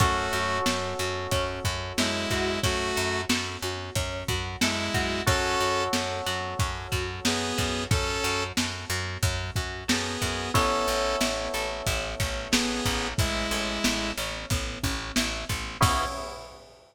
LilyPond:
<<
  \new Staff \with { instrumentName = "Lead 2 (sawtooth)" } { \time 4/4 \key cis \minor \tempo 4 = 91 <a fis'>4 r2 <gis e'>4 | <a fis'>4 r2 <gis e'>4 | <cis' a'>4 r2 <b gis'>4 | <cis' a'>4 r2 <b gis'>4 |
<cis' a'>4 r2 <b gis'>4 | <gis e'>4. r2 r8 | cis'4 r2. | }
  \new Staff \with { instrumentName = "Electric Piano 2" } { \time 4/4 \key cis \minor <cis' fis' a'>1~ | <cis' fis' a'>1 | <cis' fis' a'>1~ | <cis' fis' a'>1 |
<b cis' e' a'>1~ | <b cis' e' a'>1 | <b cis' e' gis'>4 r2. | }
  \new Staff \with { instrumentName = "Pizzicato Strings" } { \time 4/4 \key cis \minor cis'8 fis'8 a'8 fis'8 cis'8 fis'8 a'8 fis'8 | cis'8 fis'8 a'8 fis'8 cis'8 fis'8 a'8 fis'8 | cis'8 fis'8 a'8 fis'8 cis'8 fis'8 a'8 fis'8 | cis'8 fis'8 a'8 fis'8 cis'8 fis'8 a'8 fis'8 |
b8 cis'8 e'8 a'8 e'8 cis'8 b8 cis'8 | e'8 a'8 e'8 cis'8 b8 cis'8 e'8 a'8 | <b cis' e' gis'>4 r2. | }
  \new Staff \with { instrumentName = "Electric Bass (finger)" } { \clef bass \time 4/4 \key cis \minor fis,8 fis,8 fis,8 fis,8 fis,8 fis,8 fis,8 fis,8 | fis,8 fis,8 fis,8 fis,8 fis,8 fis,8 fis,8 fis,8 | fis,8 fis,8 fis,8 fis,8 fis,8 fis,8 fis,8 fis,8 | fis,8 fis,8 fis,8 fis,8 fis,8 fis,8 fis,8 fis,8 |
a,,8 a,,8 a,,8 a,,8 a,,8 a,,8 a,,8 a,,8 | a,,8 a,,8 a,,8 a,,8 a,,8 a,,8 a,,8 a,,8 | cis,4 r2. | }
  \new DrumStaff \with { instrumentName = "Drums" } \drummode { \time 4/4 <hh bd>8 hh8 sn8 hh8 <hh bd>8 <hh bd>8 sn8 <hh bd>8 | <hh bd>8 hh8 sn8 hh8 <hh bd>8 <hh bd>8 sn8 <hh bd>8 | <hh bd>8 hh8 sn8 hh8 <hh bd>8 <hh bd>8 sn8 <hh bd>8 | <hh bd>8 hh8 sn8 hh8 <hh bd>8 <hh bd>8 sn8 <hh bd>8 |
<hh bd>8 hh8 sn8 hh8 <hh bd>8 <hh bd>8 sn8 <hh bd>8 | <hh bd>8 hh8 sn8 hh8 <hh bd>8 <hh bd>8 sn8 <hh bd>8 | <cymc bd>4 r4 r4 r4 | }
>>